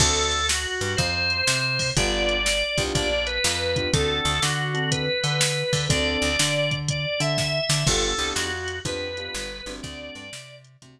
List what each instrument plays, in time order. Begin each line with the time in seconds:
0.00 electric bass (finger) D2, acoustic grand piano C4 D4 F#4 A4, drawbar organ A4, kick, crash
0.32 closed hi-hat
0.49 drawbar organ F#4, snare
0.81 electric bass (finger) G2, closed hi-hat
0.97 electric bass (finger) F2, drawbar organ C5, kick, closed hi-hat
1.30 closed hi-hat
1.47 electric bass (finger) C3, snare
1.79 kick, open hi-hat
1.97 electric bass (finger) G1, acoustic grand piano B3 D4 F4 G4, drawbar organ D5, kick, closed hi-hat
2.29 closed hi-hat
2.46 snare
2.78 electric bass (finger) C2, acoustic grand piano B3 D4 F4 G4, kick, closed hi-hat
2.95 electric bass (finger) A#1, drawbar organ D5, kick, closed hi-hat
3.27 drawbar organ B4, closed hi-hat
3.44 electric bass (finger) F2, snare
3.76 acoustic grand piano B3 D4 F4 G4, kick, closed hi-hat
3.93 electric bass (finger) D2, acoustic grand piano C4 D4 F#4 A4, drawbar organ A4, kick, closed hi-hat
4.25 electric bass (finger) D2, closed hi-hat
4.42 electric bass (finger) D3, drawbar organ F#4, snare
4.74 acoustic grand piano C4 D4 F#4 A4, closed hi-hat
4.91 drawbar organ B4, kick, closed hi-hat
5.24 electric bass (finger) D3, closed hi-hat
5.41 snare
5.73 electric bass (finger) D3, kick, open hi-hat
5.89 electric bass (finger) D2, acoustic grand piano C4 D4 F#4 A4, drawbar organ D5, kick, closed hi-hat
6.22 electric bass (finger) D2, closed hi-hat
6.39 electric bass (finger) D3, snare
6.71 kick, closed hi-hat
6.89 drawbar organ D5, kick, closed hi-hat
7.20 electric bass (finger) D3, drawbar organ E5, closed hi-hat
7.38 kick, snare
7.69 electric bass (finger) D3, snare
7.87 electric bass (finger) G1, acoustic grand piano B3 D4 F4 G4, drawbar organ A4, kick, crash
8.18 electric bass (finger) C2, acoustic grand piano B3 D4 F4 G4, closed hi-hat
8.35 electric bass (finger) F2, drawbar organ F#4, snare
8.68 closed hi-hat
8.85 electric bass (finger) F2, acoustic grand piano B3 D4 F4 G4, drawbar organ B4, kick, closed hi-hat
9.17 acoustic grand piano B3 D4 F4 G4, closed hi-hat
9.34 electric bass (finger) G1, snare
9.66 electric bass (finger) G1, acoustic grand piano A3 C4 D4 F#4, closed hi-hat
9.83 electric bass (finger) D2, drawbar organ D5, kick, closed hi-hat
10.15 electric bass (finger) G2, closed hi-hat
10.33 electric bass (finger) C3, snare
10.64 closed hi-hat
10.82 electric bass (finger) C3, acoustic grand piano A3 C4 D4 F#4, kick, closed hi-hat